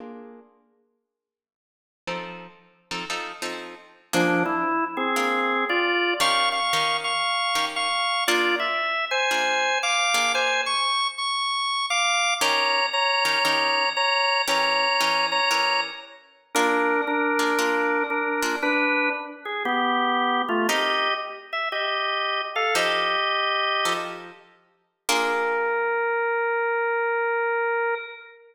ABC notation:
X:1
M:4/4
L:1/8
Q:"Swing" 1/4=116
K:Bb
V:1 name="Drawbar Organ"
z8 | z8 | [F,D] =E2 [C_A]3 [Fd]2 | [f_d'] [fd']2 [fd']3 [fd']2 |
[Fd] =e2 [c_a]3 [fd']2 | [c_a] _d'2 ^c'3 [f=d']2 | [_db]2 [db]4 [db]2 | [_db]3 [db]2 z3 |
[DB]2 [DB]4 [DB]2 | [D=B]2 z _A [=B,G]3 [=A,F] | [Ge]2 z _f [Ge]3 [A=f] | "^rit." [Ge]5 z3 |
B8 |]
V:2 name="Acoustic Guitar (steel)"
[B,DF_A]8 | [F,CEA]3 [F,CEA] [F,CEA] [F,CEA]3 | [B,DF_A]4 [B,DFA]4 | [E,_DGB]2 [E,DGB]3 [E,DGB]3 |
[B,DF_A]4 [B,DFA]3 [B,DFA]- | [B,DF_A]8 | [E,_DGB]3 [E,DGB] [E,DGB]4 | [=E,_DGB]2 [E,DGB]2 [E,DGB]4 |
[B,DF_A]3 [B,DFA] [B,DFA]3 [B,DFA] | z8 | [CEGB]8 | "^rit." [F,EAc]4 [F,EAc]4 |
[B,DF_A]8 |]